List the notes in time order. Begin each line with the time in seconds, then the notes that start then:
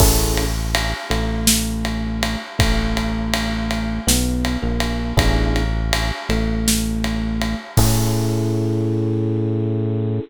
0.00 A1 C#4 E4 G#4 A4, kick, crash
0.37 ride
0.75 ride
1.10 A1 A3, ride
1.47 snare
1.85 ride
2.23 ride
2.59 A1 A3, kick, ride
2.97 ride
3.33 ride
3.71 ride
4.07 B1 B3, snare
4.45 ride
4.62 A#1 A#3
4.80 ride
5.17 A1 B3 D4 E4 G#4, kick, ride
5.56 ride
5.93 ride
6.29 A1 A3, ride
6.68 snare
7.04 ride
7.42 ride
7.77 A2 C#4 E4 G#4 A4, kick, crash